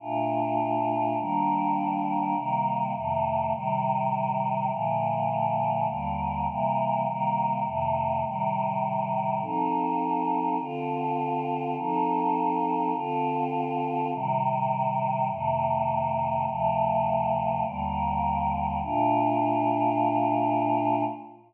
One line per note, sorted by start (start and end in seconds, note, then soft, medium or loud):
0.00 1.17 A#2 medium
0.00 1.17 A3 medium
0.00 1.17 D4 medium
0.00 1.17 F4 medium
1.18 2.34 D#3 medium
1.18 2.34 G3 loud
1.18 2.34 A#3 medium
1.18 2.34 D4 medium
2.35 2.93 C3 medium
2.35 2.93 D#3 medium
2.35 2.93 G3 medium
2.35 2.93 A#3 medium
2.94 3.52 F2 medium
2.94 3.52 C3 medium
2.94 3.52 D#3 medium
2.94 3.52 A3 medium
3.53 4.70 A2 medium
3.53 4.70 C3 loud
3.53 4.70 D#3 medium
3.53 4.70 G3 loud
4.70 5.87 A#2 loud
4.70 5.87 D3 medium
4.70 5.87 F3 medium
4.70 5.87 A3 medium
5.88 6.46 D#2 medium
5.88 6.46 D3 loud
5.88 6.46 G3 medium
5.88 6.46 A#3 medium
6.47 7.05 C3 loud
6.47 7.05 E3 medium
6.47 7.05 G3 medium
6.47 7.05 A#3 medium
7.06 7.64 C3 medium
7.06 7.64 D#3 medium
7.06 7.65 G3 medium
7.06 7.65 A#3 medium
7.65 8.23 F2 medium
7.65 8.23 C3 medium
7.65 8.23 D#3 medium
7.65 8.23 A3 medium
8.24 9.41 A2 loud
8.24 9.41 C3 medium
8.24 9.41 D#3 medium
8.24 9.41 G3 medium
9.41 10.57 F3 medium
9.41 10.57 C4 loud
9.41 10.57 D#4 medium
9.41 10.57 A4 medium
10.59 11.75 D3 medium
10.59 11.75 C4 medium
10.59 11.75 F4 medium
10.59 11.75 A4 medium
11.77 12.93 F3 loud
11.77 12.93 C4 loud
11.77 12.93 D#4 medium
11.77 12.93 A4 loud
12.94 14.11 D3 medium
12.94 14.11 C4 loud
12.94 14.11 F4 loud
12.94 14.11 A4 medium
14.12 15.29 A2 medium
14.12 15.29 C3 loud
14.12 15.29 D#3 medium
14.12 15.29 G3 medium
15.29 16.46 F2 medium
15.29 16.46 C3 loud
15.29 16.46 D#3 medium
15.29 16.46 A3 medium
16.47 17.63 D2 medium
16.47 17.63 C3 loud
16.47 17.63 F3 loud
16.47 17.63 A3 medium
17.64 18.81 D#2 loud
17.64 18.81 D3 medium
17.64 18.81 G3 medium
17.64 18.81 A#3 medium
18.82 21.02 A#2 loud
18.82 21.02 A3 medium
18.82 21.02 D4 loud
18.82 21.02 F4 loud